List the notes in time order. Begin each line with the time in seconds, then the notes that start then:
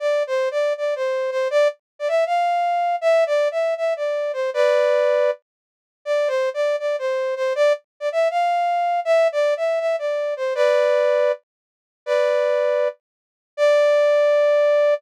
0.00 D5
0.27 C5
0.51 D5
0.77 D5
0.96 C5
1.31 C5
1.51 D5
1.99 D5
2.08 E5
2.26 F5
3.01 E5
3.27 D5
3.51 E5
3.77 E5
3.97 D5
4.33 C5
4.54 B4 D5
6.05 D5
6.28 C5
6.54 D5
6.79 D5
6.99 C5
7.36 C5
7.55 D5
8.00 D5
8.12 E5
8.31 F5
9.05 E5
9.32 D5
9.57 E5
9.80 E5
9.99 D5
10.37 C5
10.55 B4 D5
12.06 B4 D5
13.57 D5